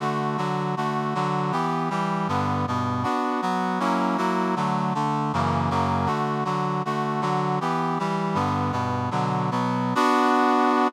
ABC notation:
X:1
M:2/4
L:1/8
Q:1/4=158
K:D
V:1 name="Brass Section"
[D,A,F]2 [D,F,F]2 | [D,A,F]2 [D,F,F]2 | [E,B,G]2 [E,G,G]2 | [G,,D,B,]2 [G,,B,,B,]2 |
[K:Bm] [B,DF]2 [F,B,F]2 | [F,^A,CE]2 [F,A,EF]2 | [D,F,A,]2 [D,A,D]2 | [F,,C,E,^A,]2 [F,,C,F,A,]2 |
[K:D] [D,A,F]2 [D,F,F]2 | [D,A,F]2 [D,F,F]2 | [E,B,G]2 [E,G,G]2 | [G,,D,B,]2 [G,,B,,B,]2 |
[K:Bm] "^rit." [B,,D,F,]2 [B,,F,B,]2 | [B,DF]4 |]